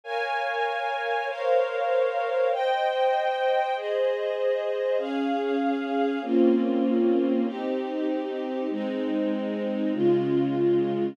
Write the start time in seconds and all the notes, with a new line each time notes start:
0.04 A#4 C#5 F5 G#5
1.27 A#4 C5 C#5 F5
2.52 C5 D#5 G5
3.76 G#4 C5 D#5
4.98 C#4 G#4 F5
6.22 A#3 C4 C#4 F4
7.45 C4 D#4 G4
8.70 G#3 C4 D#4
9.93 C#3 G#3 F4